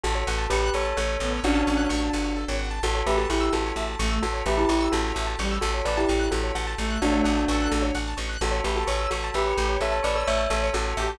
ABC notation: X:1
M:6/8
L:1/16
Q:3/8=86
K:Amix
V:1 name="Tubular Bells"
[FA]4 [GB]2 [Ac]2 [Ac]4 | [DF]8 z4 | [FA]2 [GB] [FA] [EG]2 [FA]4 z2 | [FA]2 [GB] [EG] [EG]2 [FA]4 z2 |
[FA]2 [Bd] [EG] [EG]2 [FA]4 z2 | [DF]8 z4 | [FA]2 [GB] [FA] [Ac]2 [FA]2 [GB]4 | [Ac]2 [Bd] [Ac] [ce]2 [Ac]2 [FA]4 |]
V:2 name="Clarinet"
z10 B,2 | C4 z8 | z10 A,2 | z10 G,2 |
z10 A,2 | A,4 A4 z4 | z10 G2 | z10 G2 |]
V:3 name="Acoustic Grand Piano"
A c f a c' f' c' a f c A c | f a c' f' c' a f c A c f a | A c e a c' e' A c e a c' e' | A c e a c' e' A c e a c' e' |
A c f a c' f' A c f a c' f' | A c f a c' f' A c f a c' f' | A c e a c' e' c' a e c A c | e a c' e' c' a e c A c e a |]
V:4 name="Electric Bass (finger)" clef=bass
A,,,2 A,,,2 A,,,2 A,,,2 A,,,2 A,,,2 | A,,,2 A,,,2 A,,,2 G,,,3 ^G,,,3 | A,,,2 A,,,2 A,,,2 A,,,2 A,,,2 A,,,2 | A,,,2 A,,,2 A,,,2 A,,,2 A,,,2 A,,,2 |
A,,,2 A,,,2 A,,,2 A,,,2 A,,,2 A,,,2 | A,,,2 A,,,2 A,,,2 A,,,2 A,,,2 A,,,2 | A,,,2 A,,,2 A,,,2 A,,,2 A,,,2 A,,,2 | A,,,2 A,,,2 A,,,2 A,,,2 A,,,2 A,,,2 |]